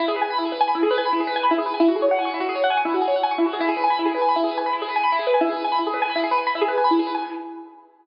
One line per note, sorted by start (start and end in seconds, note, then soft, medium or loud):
0.00 0.06 E4 loud
0.08 0.15 G#4 medium
0.16 0.23 B4 medium
0.21 0.28 G#5 medium
0.30 0.37 B5 medium
0.38 0.45 E4 medium
0.45 0.52 G#4 medium
0.52 0.59 B4 medium
0.61 0.67 G#5 loud
0.68 0.74 B5 medium
0.75 0.82 E4 medium
0.83 0.90 G#4 loud
0.91 0.97 B4 loud
0.98 1.05 G#5 medium
1.05 1.12 B5 medium
1.13 1.19 E4 medium
1.20 1.27 G#4 medium
1.27 1.34 B4 medium
1.36 1.43 G#5 medium
1.43 1.50 B5 medium
1.51 1.58 E4 loud
1.58 1.65 G#4 medium
1.66 1.73 B4 medium
1.74 1.81 G#5 medium
1.80 1.87 E4 loud
1.88 1.95 F#4 medium
1.96 2.02 G#4 medium
2.02 2.09 C#5 medium
2.11 2.18 F#5 medium
2.19 2.25 G#5 medium
2.25 2.32 C#6 medium
2.34 2.41 E4 medium
2.40 2.47 F#4 medium
2.49 2.56 G#4 medium
2.55 2.62 C#5 medium
2.64 2.70 F#5 medium
2.70 2.77 G#5 loud
2.77 2.84 C#6 medium
2.85 2.92 E4 medium
2.94 3.01 F#4 medium
3.01 3.08 G#4 medium
3.08 3.14 C#5 medium
3.16 3.23 F#5 medium
3.23 3.30 G#5 loud
3.31 3.38 C#6 loud
3.38 3.45 E4 medium
3.46 3.53 F#4 medium
3.53 3.60 G#4 medium
3.60 3.67 E4 loud
3.69 3.75 G#4 loud
3.77 3.83 B4 medium
3.84 3.90 G#5 medium
3.90 3.97 B5 medium
3.99 4.06 E4 medium
4.06 4.12 G#4 medium
4.14 4.21 B4 medium
4.21 4.28 G#5 medium
4.29 4.35 B5 medium
4.36 4.43 E4 loud
4.44 4.50 G#4 medium
4.51 4.58 B4 medium
4.58 4.64 G#5 medium
4.66 4.73 B5 medium
4.73 4.80 E4 medium
4.82 4.89 G#4 medium
4.89 4.95 B4 medium
4.96 5.03 G#5 medium
5.03 5.10 B5 medium
5.12 5.19 E4 loud
5.19 5.26 G#4 medium
5.27 5.34 B4 medium
5.34 5.41 G#5 medium
5.41 5.48 E4 loud
5.49 5.56 G#4 medium
5.57 5.63 B4 medium
5.64 5.71 G#5 medium
5.72 5.79 B5 medium
5.79 5.85 E4 medium
5.87 5.93 G#4 medium
5.94 6.00 B4 medium
6.02 6.09 G#5 loud
6.10 6.16 B5 medium
6.16 6.22 E4 medium
6.24 6.30 G#4 medium
6.31 6.38 B4 medium
6.38 6.45 G#5 medium
6.47 6.54 B5 medium
6.55 6.62 E4 medium
6.61 6.68 G#4 medium
6.68 6.75 B4 medium
6.78 6.84 G#5 medium
6.84 6.91 B5 medium
6.91 6.97 E4 medium
6.99 7.06 G#4 medium
7.07 7.14 B4 medium
7.15 7.21 G#5 loud